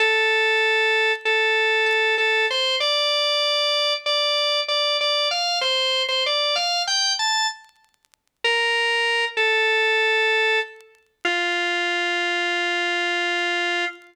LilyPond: \new Staff { \time 9/8 \key f \major \tempo 4. = 64 a'2 a'4 a'8 a'8 c''8 | d''2 d''4 d''8 d''8 f''8 | c''8. c''16 d''8 f''8 g''8 a''8 r4. | bes'4. a'2 r4 |
f'1~ f'8 | }